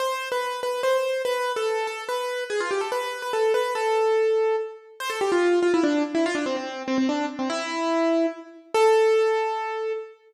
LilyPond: \new Staff { \time 3/4 \key a \minor \tempo 4 = 144 c''8. b'8. b'8 c''4 | b'8. a'8. a'8 b'4 | gis'16 f'16 g'16 a'16 b'8. b'16 a'8 b'8 | a'2 r4 |
c''16 a'16 g'16 f'8. f'16 e'16 d'8 r16 e'16 | f'16 d'16 c'16 c'8. c'16 c'16 d'8 r16 c'16 | e'2 r4 | a'2. | }